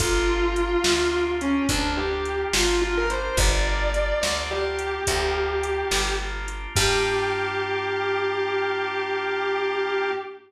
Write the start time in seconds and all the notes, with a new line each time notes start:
0.00 G1 A#3 D4 F4 G4, kick, closed hi-hat
0.56 A#3 D4 F4 G4, closed hi-hat
0.84 D2 A#3 D4 F4 G4, snare
1.41 C#4, closed hi-hat
1.69 D2 A#3 D4 F4 G4, kick, closed hi-hat
1.97 G4
2.25 closed hi-hat
2.53 G1 F4, snare
2.81 A#3 D4 F4 G4
2.97 A#4
3.10 A#3 D4 F4 G4 C5, closed hi-hat
3.37 G1 A#3 D4 F4 G4 D5, kick, closed hi-hat
3.94 A#3 D4 F4 G4, closed hi-hat
4.21 D2 A#3 D4 F4 G4 D5, snare
4.51 G4
4.79 closed hi-hat
5.07 D2 A#3 D4 F4 G4, kick, closed hi-hat
5.63 closed hi-hat
5.91 G1, snare
6.20 A#3 D4 F4 G4
6.48 A#3 D4 F4 G4, closed hi-hat
6.75 G2 A#3 D4 F4 G4, kick, crash